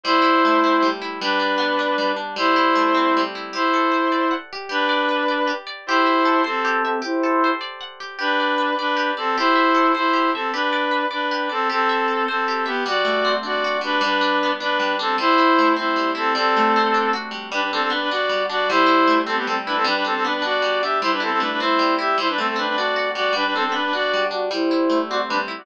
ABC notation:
X:1
M:6/8
L:1/16
Q:3/8=103
K:G
V:1 name="Clarinet"
[Ec]10 z2 | [DB]10 z2 | [Ec]10 z2 | [Ec]10 z2 |
[DB]10 z2 | [Ec]6 [CA]4 [CA]2 | [Ec]6 z6 | [DB]6 [DB]4 [CA]2 |
[Ec]6 [Ec]4 [CA]2 | [DB]6 [DB]4 [CA]2 | [CA]6 [CA]4 [B,G]2 | [Fd]6 [Fd]4 [DB]2 |
[DB]6 [DB]4 [CA]2 | [Ec]6 [Ec]4 [CA]2 | [CA]8 z4 | [DB] [DB] [CA] [CA] [DB] [DB] [Fd]4 [Fd]2 |
[Ec]6 [CA] [B,G] [CA] z [DB] [CA] | [DB] [DB] [CA] [CA] [DB] [DB] [Fd]4 [Ge]2 | [Ec] [DB] [CA] [CA] [DB] [DB] [Ec]4 [Ge]2 | [Ec] [DB] [CA] [CA] [DB] [DB] [Fd]4 [Fd]2 |
[DB] [DB] [CA] [CA] [DB] [DB] [Fd]4 [Fd]2 | [Ec]6 [Fd] z [DB] z2 [Fd] |]
V:2 name="Acoustic Guitar (steel)"
G,2 E2 A,2 C2 G,2 E2 | G,2 D2 B,2 D2 G,2 D2 | G,2 E2 A,2 C2 G,2 E2 | G2 A2 c2 d2 f2 G2 |
G2 d2 B2 d2 G2 d2 | G2 e2 A2 c2 G2 e2 | G2 A2 c2 d2 f2 G2 | G2 d2 B2 d2 G2 d2 |
G2 e2 A2 c2 G2 e2 | G2 d2 B2 d2 G2 d2 | G2 e2 A2 c2 G2 e2 | G,2 A,2 C2 D2 F2 G,2 |
G,2 D2 B,2 D2 G,2 D2 | G,2 E2 A,2 C2 G,2 E2 | G,2 A,2 C2 D2 F2 G,2 | G,2 D2 B,2 D2 G,2 D2 |
G,2 E2 A,2 C2 G,2 E2 | G,2 D2 B,2 D2 G,2 D2 | G,2 E2 A,2 C2 G,2 E2 | G,2 A,2 C2 D2 F2 G,2 |
G,2 D2 B,2 D2 G,2 D2 | G,2 E2 A,2 C2 G,2 E2 |]